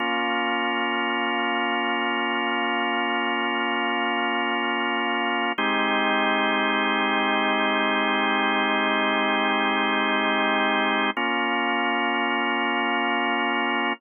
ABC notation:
X:1
M:4/4
L:1/8
Q:1/4=86
K:Bbm
V:1 name="Drawbar Organ"
[B,DF]8- | [B,DF]8 | [A,CE=G]8- | [A,CE=G]8 |
[B,DF]8 |]